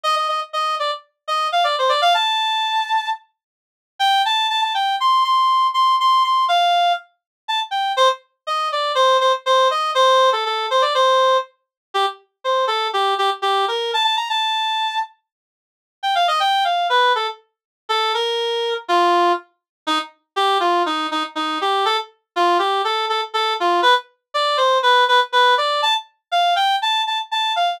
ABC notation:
X:1
M:4/4
L:1/16
Q:1/4=121
K:Cdor
V:1 name="Clarinet"
e e e z e2 d z3 e2 f d c d | f a9 z6 | g2 a2 a a g2 c'2 c'4 c'2 | c'2 c'2 f4 z4 a z g2 |
c z3 e2 d2 c2 c z c2 e2 | c3 A A2 c d c4 z4 | G z3 c2 A2 G2 G z G2 B2 | a a b a7 z6 |
z g f e g2 f2 =B2 A z5 | A2 B6 F4 z4 | E z3 G2 F2 E2 E z E2 G2 | A z3 F2 G2 A2 A z A2 F2 |
=B z3 d2 c2 B2 B z B2 d2 | a z3 f2 g2 a2 a z a2 f2 |]